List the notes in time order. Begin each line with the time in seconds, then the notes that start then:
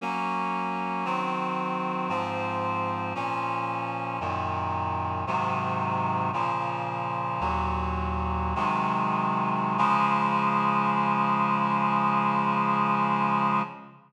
0.01 F#3 A#3 C#4
1.05 D#3 F#3 C4
2.09 G#2 F3 C4
3.15 A#2 F3 C#4
4.20 F#2 A#2 D#3
5.27 G#2 C3 D#3 F#3
6.33 A#2 C#3 F3
7.40 D#2 A#2 F#3
8.55 C3 D#3 F#3 G#3
9.78 C#3 F3 G#3